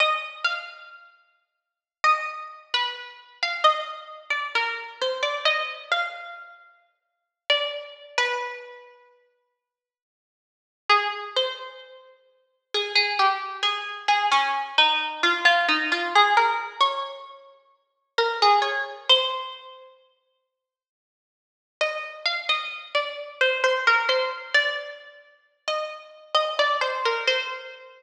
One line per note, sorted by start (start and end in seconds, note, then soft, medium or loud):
0.00 0.41 D#5 medium
0.45 1.66 F5 medium
2.04 2.26 D#5 medium
2.74 2.95 B4 loud
3.43 3.64 F5 medium
3.64 4.04 D#5 medium
4.30 4.52 D5 medium
4.55 4.97 A#4 medium
5.02 5.23 C5 medium
5.23 5.44 D5 medium
5.45 5.83 D#5 medium
5.92 7.13 F5 medium
7.50 7.71 D5 medium
8.18 8.91 B4 loud
10.89 11.33 G#4 medium
11.36 12.62 C5 medium
12.74 12.95 G#4 medium
12.95 13.17 G#4 loud
13.19 13.56 G4 medium
13.63 14.07 G#4 loud
14.08 14.30 G#4 medium
14.32 14.72 C#4 loud
14.78 15.22 D#4 medium
15.23 15.45 F4 medium
15.45 15.67 F4 loud
15.69 15.90 D#4 medium
15.92 16.13 F4 medium
16.15 16.37 G#4 loud
16.37 16.77 A#4 loud
16.80 18.07 C#5 medium
18.18 18.40 A#4 medium
18.42 18.64 G#4 medium
18.62 19.00 C#5 medium
19.09 19.92 C5 loud
21.81 22.23 D#5 medium
22.26 22.47 F5 medium
22.49 22.89 D#5 medium
22.95 23.39 D5 medium
23.41 23.63 C5 medium
23.64 23.85 C5 loud
23.87 24.09 A#4 medium
24.09 24.30 C5 medium
24.54 24.96 D5 loud
25.68 26.07 D#5 medium
26.35 26.56 D#5 medium
26.59 26.81 D5 medium
26.81 27.03 C5 medium
27.05 27.27 A#4 medium
27.27 28.03 C5 loud